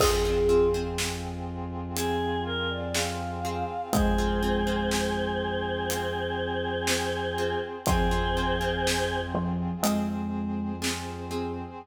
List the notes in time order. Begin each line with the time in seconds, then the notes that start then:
0.00 F2 C4 F4 G#4, kick, crash
0.25 C4 F4 G#4
0.49 C4 F4 G#4
0.74 C4 F4 G#4
0.98 snare
1.95 C4 F4 G#4, closed hi-hat
2.45 A#4
2.70 D5
2.94 C4 F4 G#4 F5, snare
3.45 C4 F4 G#4
3.93 F2 G#3 C4 G#4 C5, kick, closed hi-hat
4.18 C4 F4 G#4
4.43 C4 F4 G#4
4.67 C4 F4 G#4
4.91 snare
5.90 C4 F4 G#4, closed hi-hat
6.87 C4 F4 G#4, snare
7.38 C4 F4 G#4
7.86 F2 F3 C4 F4 G#4 C5, kick, closed hi-hat
8.11 C4 F4 G#4
8.37 C4 F4 G#4
8.61 C4 F4 G#4
8.87 snare
9.35 F3
9.82 F2 G#3 C4 F4 G#4 C5, closed hi-hat
10.82 C4 F4 G#4, snare
11.31 C4 F4 G#4